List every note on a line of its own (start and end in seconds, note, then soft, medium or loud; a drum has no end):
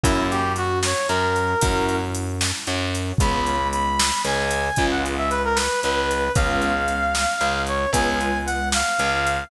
0.04 0.93 F#2 loud
0.04 0.41 A#3 loud
0.04 0.41 C#4 loud
0.04 0.26 E4 loud
0.04 0.41 E4 loud
0.04 0.41 F#4 loud
0.04 kick loud
0.04 closed hi-hat loud
0.30 0.53 G4 loud
0.30 closed hi-hat medium
0.56 0.79 F#4 loud
0.56 closed hi-hat medium
0.83 1.07 C#5 medium
0.83 snare loud
1.08 1.54 F#2 medium
1.08 1.54 F#3 medium
1.08 1.96 A#4 loud
1.08 closed hi-hat medium
1.36 closed hi-hat medium
1.61 2.52 F#2 loud
1.61 1.99 A#3 loud
1.61 1.99 C#4 loud
1.61 1.99 E4 loud
1.61 1.99 F#4 loud
1.61 kick loud
1.61 closed hi-hat loud
1.89 closed hi-hat medium
2.15 closed hi-hat loud
2.41 snare loud
2.67 3.12 F#2 medium
2.67 3.12 F#3 medium
2.67 closed hi-hat medium
2.95 closed hi-hat medium
3.18 4.10 C#2 loud
3.18 3.57 G#3 loud
3.18 3.57 B3 loud
3.18 3.57 C#4 loud
3.18 3.57 F4 loud
3.18 3.68 B5 loud
3.18 kick loud
3.18 closed hi-hat loud
3.46 closed hi-hat medium
3.72 4.22 B5 loud
3.72 closed hi-hat medium
4.00 snare loud
4.25 4.69 C#2 medium
4.25 4.70 C#3 medium
4.25 4.86 G#5 loud
4.25 closed hi-hat medium
4.51 closed hi-hat loud
4.76 5.68 C#2 loud
4.76 5.15 G#3 loud
4.76 5.15 B3 loud
4.76 5.15 C#4 loud
4.76 5.15 F4 loud
4.76 kick medium
4.76 closed hi-hat medium
4.91 5.04 F#5 loud
5.06 closed hi-hat medium
5.17 5.30 E5 loud
5.30 5.43 B4 loud
5.30 closed hi-hat medium
5.45 5.57 A#4 loud
5.55 5.80 B4 loud
5.55 snare loud
5.82 6.29 C#2 medium
5.82 6.28 C#3 medium
5.82 6.32 B4 loud
5.82 closed hi-hat medium
6.11 closed hi-hat medium
6.35 7.25 C#2 loud
6.35 6.72 G#3 loud
6.35 6.72 B3 loud
6.35 6.72 C#4 loud
6.35 6.72 F4 loud
6.35 7.60 F5 loud
6.35 kick loud
6.35 closed hi-hat loud
6.62 closed hi-hat medium
6.88 closed hi-hat medium
7.15 snare loud
7.41 7.86 C#2 medium
7.41 7.86 C#3 medium
7.41 closed hi-hat medium
7.67 7.90 C#5 medium
7.67 closed hi-hat medium
7.93 8.82 C#2 loud
7.93 8.30 G#3 loud
7.93 8.30 B3 loud
7.93 8.30 C#4 loud
7.93 8.30 F4 loud
7.93 8.38 G#5 loud
7.93 kick medium
7.93 closed hi-hat loud
8.21 closed hi-hat medium
8.46 8.69 F#5 loud
8.46 closed hi-hat medium
8.72 9.44 F5 loud
8.72 snare loud
8.99 9.44 C#2 loud
8.99 9.43 C#3 medium
8.99 closed hi-hat medium
9.27 closed hi-hat medium